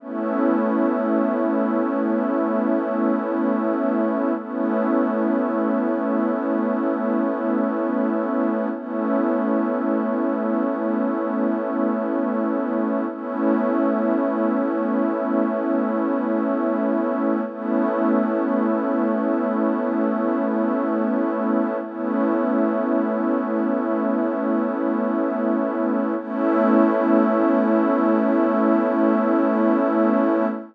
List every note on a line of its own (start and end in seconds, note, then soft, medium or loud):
0.00 4.32 A3 medium
0.00 4.32 B3 medium
0.00 4.32 C#4 medium
0.00 4.32 E4 medium
4.37 8.68 A3 medium
4.37 8.68 B3 medium
4.37 8.68 C#4 medium
4.37 8.68 E4 medium
8.73 13.05 A3 medium
8.73 13.05 B3 medium
8.73 13.05 C#4 medium
8.73 13.05 E4 medium
13.09 17.41 A3 medium
13.09 17.41 B3 medium
13.09 17.41 C#4 medium
13.09 17.41 E4 medium
17.45 21.77 A3 medium
17.45 21.77 B3 medium
17.45 21.77 C#4 medium
17.45 21.77 E4 medium
21.82 26.14 A3 medium
21.82 26.14 B3 medium
21.82 26.14 C#4 medium
21.82 26.14 E4 medium
26.18 30.45 A3 loud
26.18 30.45 B3 medium
26.18 30.45 C#4 loud
26.18 30.45 E4 loud